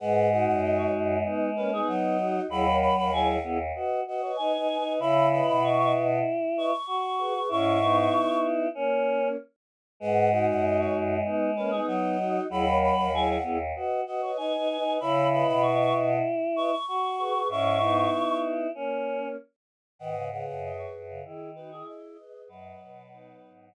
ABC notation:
X:1
M:4/4
L:1/16
Q:1/4=96
K:G#m
V:1 name="Choir Aahs"
f2 f f d c z4 B G d4 | b2 b b g f z4 d c g4 | b2 b b c' c' z4 c' c' c'4 | c'6 z10 |
f2 f f d c z4 B G d4 | b2 b b g f z4 d c g4 | b2 b b c' c' z4 c' c' c'4 | c'6 z10 |
f2 f f d c z4 B G d4 | B8 z8 |]
V:2 name="Choir Aahs"
[GB]2 [DF]6 [B,D]2 [A,C] [B,D]3 [DF]2 | [EG] [Ac]2 [Ac] [EG]2 [EG] z [Bd]2 [Bd] [Bd] [Bd] [Bd] [Bd] [Bd] | [ce]2 [Bd]6 z2 [Bd] z3 [GB] [GB] | [CE]2 [B,D]6 [A,C]4 z4 |
[GB]2 [DF]6 [B,D]2 [A,C] [B,D]3 [DF]2 | [EG] [Ac]2 [Ac] [EG]2 [EG] z [Bd]2 [Bd] [Bd] [Bd] [Bd] [Bd] [Bd] | [ce]2 [Bd]6 z2 [Bd] z3 [GB] [GB] | [CE]2 [B,D]6 [A,C]4 z4 |
[Bd]2 [GB]6 [EG]2 [DF] [EG]3 [GB]2 | [Bd]4 [B,D]4 z8 |]
V:3 name="Choir Aahs"
G,12 F,4 | F,4 F,2 B, z F2 F2 (3D2 D2 D2 | E12 F4 | E8 C4 z4 |
G,12 F,4 | F,4 F,2 B, z F2 F2 (3D2 D2 D2 | E12 F4 | E8 C4 z4 |
D, C, C,3 z2 C, D,4 z4 | F,10 z6 |]
V:4 name="Choir Aahs" clef=bass
G,,3 F,,3 F,,2 z8 | D,,3 D,,3 D,,2 z8 | C,3 B,,3 B,,2 z8 | G,,4 z12 |
G,,3 F,,3 F,,2 z8 | D,,3 D,,3 D,,2 z8 | C,3 B,,3 B,,2 z8 | G,,4 z12 |
G,,3 F,,3 F,,2 z8 | F,,2 B,,4 G,,2 z8 |]